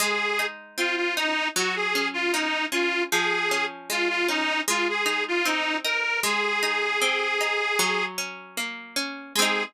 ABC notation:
X:1
M:4/4
L:1/16
Q:1/4=77
K:Abmix
V:1 name="Accordion"
A3 z F F E2 G A2 F E2 F2 | A3 z F F E2 F A2 F E2 B2 | A10 z6 | A4 z12 |]
V:2 name="Pizzicato Strings"
A,2 E2 C2 E2 G,2 D2 B,2 D2 | F,2 D2 A,2 D2 A,2 E2 C2 E2 | A,2 E2 C2 E2 G,2 D2 B,2 D2 | [A,CE]4 z12 |]